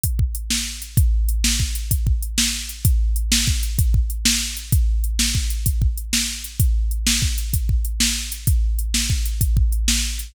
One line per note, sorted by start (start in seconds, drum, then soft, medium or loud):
0.03 kick medium
0.03 closed hi-hat medium
0.19 kick medium
0.35 closed hi-hat medium
0.50 snare medium
0.82 closed hi-hat medium
0.97 kick loud
0.97 closed hi-hat medium
1.29 closed hi-hat medium
1.44 snare loud
1.60 kick medium
1.75 closed hi-hat medium
1.91 kick medium
1.91 closed hi-hat medium
2.07 kick medium
2.22 closed hi-hat medium
2.38 snare loud
2.69 closed hi-hat medium
2.85 kick medium
2.85 closed hi-hat medium
3.16 closed hi-hat medium
3.32 snare loud
3.47 kick medium
3.63 closed hi-hat medium
3.79 kick medium
3.79 closed hi-hat medium
3.94 kick medium
4.10 closed hi-hat medium
4.25 snare loud
4.57 closed hi-hat medium
4.72 kick medium
4.72 closed hi-hat medium
5.04 closed hi-hat medium
5.19 snare medium
5.35 kick medium
5.50 closed hi-hat medium
5.66 kick medium
5.66 closed hi-hat medium
5.82 kick medium
5.97 closed hi-hat medium
6.13 snare loud
6.44 closed hi-hat medium
6.60 kick medium
6.60 closed hi-hat medium
6.91 closed hi-hat medium
7.07 snare loud
7.22 kick medium
7.38 closed hi-hat medium
7.53 kick medium
7.53 closed hi-hat medium
7.69 kick medium
7.85 closed hi-hat medium
8.00 snare loud
8.32 closed hi-hat medium
8.47 kick medium
8.47 closed hi-hat medium
8.79 closed hi-hat medium
8.94 snare medium
9.10 kick medium
9.25 closed hi-hat medium
9.41 kick medium
9.41 closed hi-hat medium
9.57 kick medium
9.72 closed hi-hat medium
9.88 snare loud
10.19 closed hi-hat medium